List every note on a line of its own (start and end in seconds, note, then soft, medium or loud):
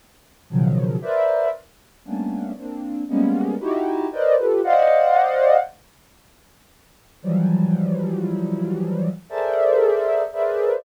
0.50 0.97 B2 loud
0.50 0.97 C#3 loud
0.50 0.97 D#3 loud
0.50 0.97 F3 loud
0.50 0.97 F#3 loud
1.02 1.48 A#4 medium
1.02 1.48 B4 medium
1.02 1.48 C5 medium
1.02 1.48 D5 medium
1.02 1.48 E5 medium
2.05 2.52 G3 medium
2.05 2.52 A3 medium
2.05 2.52 A#3 medium
2.05 2.52 B3 medium
2.05 2.52 C#4 medium
2.05 2.52 D4 medium
2.57 3.03 A#3 medium
2.57 3.03 C4 medium
2.57 3.03 D4 medium
3.09 3.55 G3 medium
3.09 3.55 G#3 medium
3.09 3.55 A#3 medium
3.09 3.55 B3 medium
3.09 3.55 C#4 medium
3.60 4.07 D#4 loud
3.60 4.07 E4 loud
3.60 4.07 F#4 loud
3.60 4.07 G4 loud
4.12 4.36 A#4 medium
4.12 4.36 B4 medium
4.12 4.36 C5 medium
4.12 4.36 D5 medium
4.12 4.36 D#5 medium
4.38 4.61 F4 medium
4.38 4.61 G4 medium
4.38 4.61 A4 medium
4.38 4.61 B4 medium
4.64 5.57 C5 medium
4.64 5.57 D5 medium
4.64 5.57 D#5 medium
4.64 5.57 F5 medium
4.64 5.57 F#5 medium
7.22 9.09 E3 loud
7.22 9.09 F3 loud
7.22 9.09 F#3 loud
7.22 9.09 G3 loud
9.30 10.23 G#4 medium
9.30 10.23 A4 medium
9.30 10.23 A#4 medium
9.30 10.23 C5 medium
9.30 10.23 D5 medium
9.30 10.23 E5 medium
10.33 10.79 G#4 medium
10.33 10.79 A#4 medium
10.33 10.79 B4 medium
10.33 10.79 C5 medium
10.33 10.79 D5 medium
10.33 10.79 E5 medium